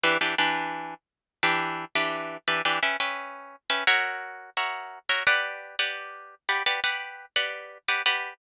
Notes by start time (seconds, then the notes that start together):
0.03 E3 D4 G4 B4
0.21 E3 D4 G4 B4
0.38 E3 D4 G4 B4
1.43 E3 D4 G4 B4
1.95 E3 D4 G4 B4
2.48 E3 D4 G4 B4
2.65 E3 D4 G4 B4
2.83 C#4 B4 E5 G5
3.00 C#4 B4 E5 G5
3.70 C#4 B4 E5 G5
3.87 F#4 A#4 C#5 E5
4.57 F#4 A#4 C#5 E5
5.09 F#4 A#4 C#5 E5
5.27 G4 B4 D5 F#5
5.79 G4 B4 D5 F#5
6.49 G4 B4 D5 F#5
6.66 G4 B4 D5 F#5
6.84 G4 B4 D5 F#5
7.36 G4 B4 D5 F#5
7.88 G4 B4 D5 F#5
8.06 G4 B4 D5 F#5